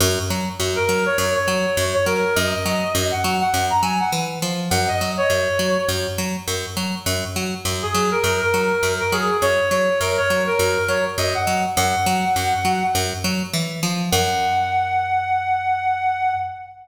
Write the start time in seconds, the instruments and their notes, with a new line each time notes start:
0.00 electric bass (finger) F#2
0.30 electric bass (finger) F#3
0.60 electric bass (finger) F#2
0.76 clarinet A#4
0.89 electric bass (finger) F#3
1.06 clarinet C#5
1.18 electric bass (finger) F#2, clarinet C#5
1.35 clarinet C#5
1.48 electric bass (finger) F#3
1.77 electric bass (finger) F#2
1.94 clarinet C#5
2.06 electric bass (finger) F#3, clarinet A#4
2.36 electric bass (finger) F#2, clarinet D#5
2.66 electric bass (finger) F#3
2.95 electric bass (finger) F#2
3.11 clarinet F#5
3.24 electric bass (finger) F#3
3.40 clarinet F#5
3.54 electric bass (finger) F#2
3.70 clarinet A#5
3.82 electric bass (finger) F#3, clarinet G#5
4.00 clarinet F#5
4.12 electric bass (finger) E3
4.42 electric bass (finger) F3
4.70 electric bass (finger) F#2, clarinet F#5
4.88 clarinet D#5
5.01 electric bass (finger) F#3
5.17 clarinet C#5
5.30 electric bass (finger) F#2
5.59 electric bass (finger) F#3
5.88 electric bass (finger) F#2
6.18 electric bass (finger) F#3
6.48 electric bass (finger) F#2
6.77 electric bass (finger) F#3
7.06 electric bass (finger) F#2
7.36 electric bass (finger) F#3
7.65 electric bass (finger) F#2
7.82 clarinet G#4
7.94 electric bass (finger) F#3
8.11 clarinet A#4
8.24 electric bass (finger) F#2, clarinet A#4
8.41 clarinet A#4
8.54 electric bass (finger) F#3
8.83 electric bass (finger) F#2
9.00 clarinet A#4
9.12 electric bass (finger) F#3, clarinet G#4
9.42 electric bass (finger) F#2, clarinet C#5
9.70 electric bass (finger) F#3, clarinet C#5
10.00 electric bass (finger) F#2, clarinet A#4
10.18 clarinet C#5
10.30 electric bass (finger) F#3
10.47 clarinet A#4
10.59 electric bass (finger) F#2
10.88 electric bass (finger) F#3, clarinet C#5
11.18 electric bass (finger) F#2, clarinet D#5
11.35 clarinet F#5
11.47 electric bass (finger) F#3
11.76 electric bass (finger) F#2, clarinet F#5
12.06 electric bass (finger) F#3
12.36 electric bass (finger) F#2
12.65 electric bass (finger) F#3
12.95 electric bass (finger) F#2
13.24 electric bass (finger) F#3
13.54 electric bass (finger) E3
13.83 electric bass (finger) F3
14.11 electric bass (finger) F#2, clarinet F#5